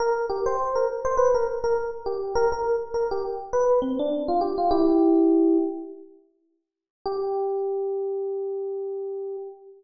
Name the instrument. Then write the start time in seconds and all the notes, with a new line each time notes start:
electric piano 1
0.00 A#4
0.30 G4
0.46 C5
0.75 A#4
1.05 C5
1.17 B4
1.34 A#4
1.64 A#4
2.06 G4
2.35 A#4
2.52 A#4
2.94 A#4
3.11 G4
3.53 B4
3.82 C4
3.99 D4
4.28 F4
4.41 G4
4.58 F4
4.71 E4 G4
7.06 G4